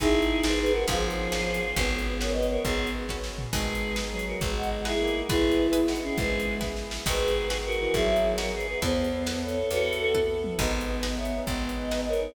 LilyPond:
<<
  \new Staff \with { instrumentName = "Choir Aahs" } { \time 6/8 \key gis \minor \tempo 4. = 136 <e' gis'>4. <gis' b'>8 <gis' b'>8 <fis' ais'>8 | <eis' gis'>2. | <gis' b'>4. <ais' cis''>8 <b' dis''>8 <ais' cis''>8 | <gis' b'>4 r2 |
<gis' b'>4. r8 <gis' b'>8 <fis' ais'>8 | <gis' b'>8 <dis' fis'>8 r8 <e' gis'>4. | <gis' b'>4. r8 <dis' fis'>8 <e' gis'>8 | <gis' b'>4. r4. |
<gis' b'>2 <fis' ais'>4 | <e' gis'>4. <fis' ais'>8 <gis' b'>8 <gis' b'>8 | bis'2 <a' cis''>4 | <fis' a'>4. r4. |
<b' dis''>2 <cis'' e''>4 | <b' dis''>2 <ais' cis''>4 | }
  \new Staff \with { instrumentName = "Violin" } { \time 6/8 \key gis \minor dis'2. | eis2. | b2. | b4. r4. |
gis2 fis4 | gis2 ais4 | e'2~ e'8 cis'8 | gis4. r4. |
r2 r8 e8 | fis2 r4 | b2. | b'4 a'8 a'4 r8 |
b2. | b2~ b8 dis'8 | }
  \new Staff \with { instrumentName = "Pizzicato Strings" } { \time 6/8 \key gis \minor <dis' gis' b'>4. <dis' gis' b'>4. | <cis' eis' gis' b'>4. <cis' eis' gis' b'>4. | <cis' fis' b'>4. <cis' fis' b'>4.~ | <cis' fis' b'>4. <cis' fis' b'>4. |
<dis' gis' b'>4. <dis' gis' b'>4.~ | <dis' gis' b'>4. <dis' gis' b'>4. | <e' gis' b'>4. <e' gis' b'>4.~ | <e' gis' b'>4. <e' gis' b'>4. |
<dis' fis' gis' b'>4. <dis' fis' gis' b'>4.~ | <dis' fis' gis' b'>4. <dis' fis' gis' b'>4. | <e' a' b'>4. <e' a' b'>4.~ | <e' a' b'>4. <e' a' b'>4. |
<dis' gis' b'>4. <dis' gis' b'>4.~ | <dis' gis' b'>4. <dis' gis' b'>4. | }
  \new Staff \with { instrumentName = "Electric Bass (finger)" } { \clef bass \time 6/8 \key gis \minor gis,,4. gis,,4. | gis,,4. gis,,4. | gis,,2. | gis,,2. |
gis,,2. | gis,,2. | gis,,2. | gis,,2. |
gis,,2. | gis,,2. | e,2. | e,2. |
gis,,2. | gis,,2. | }
  \new Staff \with { instrumentName = "Brass Section" } { \time 6/8 \key gis \minor <b dis' gis'>2. | <b cis' eis' gis'>2. | <b cis' fis'>2.~ | <b cis' fis'>2. |
<b dis' gis'>2.~ | <b dis' gis'>2. | <b e' gis'>2.~ | <b e' gis'>2. |
<b dis' fis' gis'>2.~ | <b dis' fis' gis'>2. | <b e' a'>2.~ | <b e' a'>2. |
<b dis' gis'>2.~ | <b dis' gis'>2. | }
  \new DrumStaff \with { instrumentName = "Drums" } \drummode { \time 6/8 <hh bd>8. hh8. sn8. hh8. | <hh bd>8. hh8. sn8. hh8. | <hh bd>8. hh8. sn8. hh8. | <hh bd>8. hh8. <bd sn>8 sn8 tomfh8 |
<cymc bd>8. hh8. sn8. hh8. | <hh bd>8. hh8. sn8. hh8. | <hh bd>8. hh8. hh8 sn16 hh8. | <hh bd>8. hh8. <bd sn>8 sn8 sn8 |
<cymc bd>8. hh8. sn8. hh8. | <hh bd>8. hh8. sn8. hh8. | <hh bd>8. hh8. sn8. hh8. | hh8. hh8. <bd tommh>4 toml8 |
<cymc bd>8. hh8. sn8. hh8. | <hh bd>8. hh8. sn8. hh8. | }
>>